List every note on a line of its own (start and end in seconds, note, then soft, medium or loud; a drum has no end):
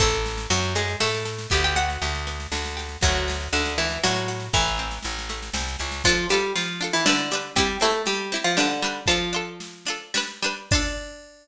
0.00 0.47 A1 medium
0.00 0.47 A3 medium
0.00 0.45 C4 medium
0.00 0.45 E4 medium
0.00 0.47 A4 medium
0.00 0.45 A4 medium
0.00 kick medium
0.00 snare medium
0.13 snare medium
0.26 snare medium
0.38 snare medium
0.50 0.95 F#2 medium
0.50 0.73 F#3 medium
0.50 1.47 C4 medium
0.50 0.73 F#4 medium
0.50 snare medium
0.62 snare medium
0.75 0.97 G#3 medium
0.75 1.47 D4 medium
0.75 0.97 G#4 medium
0.75 snare medium
0.88 snare medium
1.00 1.47 A2 medium
1.00 1.47 A3 medium
1.00 1.49 F#4 medium
1.00 1.47 A4 medium
1.00 snare medium
1.14 snare medium
1.25 1.49 A4 medium
1.25 snare medium
1.39 snare medium
1.50 1.98 D2 loud
1.50 2.26 B3 medium
1.50 1.63 G4 medium
1.50 1.63 G5 medium
1.50 kick medium
1.50 snare medium
1.63 1.76 G4 medium
1.63 1.76 G5 medium
1.63 snare medium
1.76 2.51 D4 medium
1.76 2.22 F#4 medium
1.76 2.22 F#5 medium
1.76 snare medium
1.90 snare medium
2.02 2.47 D2 medium
2.02 2.76 G4 medium
2.02 snare medium
2.15 snare medium
2.27 2.99 B3 medium
2.27 snare medium
2.40 snare medium
2.52 2.97 D2 medium
2.52 2.99 D4 medium
2.52 snare medium
2.66 snare medium
2.77 3.01 G4 medium
2.77 snare medium
2.89 snare soft
3.01 3.49 D2 medium
3.01 3.46 F#3 medium
3.01 3.77 A3 medium
3.01 3.46 F#4 medium
3.01 kick medium
3.01 snare medium
3.15 snare medium
3.28 4.03 D4 medium
3.28 snare medium
3.41 snare medium
3.53 3.98 D2 medium
3.53 3.74 D3 medium
3.53 3.74 D4 medium
3.53 4.28 F#4 medium
3.53 snare medium
3.65 snare medium
3.78 3.99 E3 medium
3.78 4.50 A3 medium
3.78 3.99 E4 medium
3.78 snare medium
3.90 snare medium
4.03 4.49 A2 medium
4.03 4.46 F#3 medium
4.03 4.51 D4 medium
4.03 4.46 F#4 medium
4.03 snare medium
4.14 snare medium
4.28 4.52 F#4 medium
4.28 snare medium
4.40 snare medium
4.53 4.99 A1 medium
4.53 4.95 E3 medium
4.53 5.29 A3 medium
4.53 4.95 E4 medium
4.53 kick medium
4.53 snare medium
4.67 snare soft
4.77 5.54 C4 medium
4.77 snare medium
4.91 snare medium
5.03 5.50 A1 medium
5.03 5.79 E4 medium
5.03 snare medium
5.19 snare medium
5.29 6.01 A3 medium
5.29 snare medium
5.42 snare medium
5.54 5.76 C2 medium
5.54 6.02 C4 medium
5.54 snare medium
5.68 snare medium
5.79 6.03 C#2 medium
5.79 6.03 E4 medium
5.79 snare medium
5.92 snare medium
6.04 6.26 F3 medium
6.04 6.29 D4 loud
6.04 6.26 F4 loud
6.04 6.29 F4 loud
6.04 kick medium
6.04 snare medium
6.09 6.29 A4 loud
6.29 6.53 G3 medium
6.29 6.77 D4 medium
6.29 6.77 F4 medium
6.29 6.53 G4 medium
6.29 snare medium
6.34 6.77 A4 medium
6.56 6.91 F3 medium
6.56 6.91 F4 medium
6.56 snare medium
6.81 7.04 D4 medium
6.81 7.04 F4 medium
6.81 7.04 A4 medium
6.81 snare medium
6.93 7.05 E3 medium
6.93 7.05 E4 medium
7.06 7.50 D3 medium
7.06 7.29 G3 loud
7.06 7.50 D4 medium
7.06 7.29 D4 medium
7.06 7.29 B4 loud
7.06 snare loud
7.31 7.55 G3 medium
7.31 7.55 D4 loud
7.31 7.55 B4 medium
7.31 snare medium
7.56 7.77 G3 medium
7.56 7.80 C4 loud
7.56 7.80 E4 loud
7.56 7.77 G4 medium
7.56 kick medium
7.56 snare medium
7.60 7.80 G4 loud
7.80 8.02 A3 medium
7.80 8.27 C4 medium
7.80 8.27 E4 loud
7.80 8.02 A4 medium
7.80 snare medium
7.84 8.27 G4 medium
8.06 8.38 G3 medium
8.06 8.38 G4 medium
8.06 snare medium
8.32 8.55 C4 medium
8.32 8.55 E4 loud
8.32 8.55 G4 medium
8.32 snare medium
8.44 8.56 F3 medium
8.44 8.56 F4 medium
8.57 9.01 D3 medium
8.57 8.80 G3 loud
8.57 9.01 D4 medium
8.57 8.80 D4 loud
8.57 8.80 B4 loud
8.57 snare medium
8.82 9.06 G3 loud
8.82 9.06 D4 medium
8.82 9.06 B4 medium
8.82 snare soft
9.06 9.99 F3 medium
9.06 9.31 D4 loud
9.06 9.99 F4 medium
9.06 9.31 F4 loud
9.06 kick medium
9.06 snare medium
9.11 9.31 A4 loud
9.33 9.82 D4 medium
9.33 9.82 F4 medium
9.33 9.82 A4 medium
9.60 snare medium
9.86 10.12 D4 medium
9.86 10.12 F4 medium
9.86 snare medium
9.90 10.12 A4 medium
10.14 10.40 G3 loud
10.14 10.40 D4 medium
10.14 10.40 B4 loud
10.14 snare medium
10.42 10.69 G3 medium
10.42 10.69 D4 loud
10.42 10.69 B4 medium
10.42 snare medium
10.71 11.47 D4 loud
10.71 11.47 F4 loud
10.71 kick loud
10.71 crash loud
10.75 11.47 A4 loud